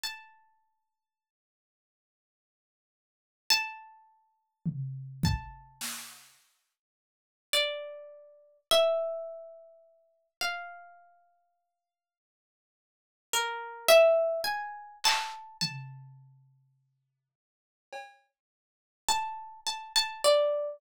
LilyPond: <<
  \new Staff \with { instrumentName = "Orchestral Harp" } { \time 9/8 \tempo 4. = 35 a''2. a''4. | a''2 d''4 e''4. | f''2~ f''8 ais'8 e''8 gis''8 a''8 | a''2. a''8 a''16 a''16 d''8 | }
  \new DrumStaff \with { instrumentName = "Drums" } \drummode { \time 9/8 r4. r4. r4 tomfh8 | bd8 sn4 r4. r4. | r4. r4. r4 hc8 | tomfh4. r8 cb4 r4. | }
>>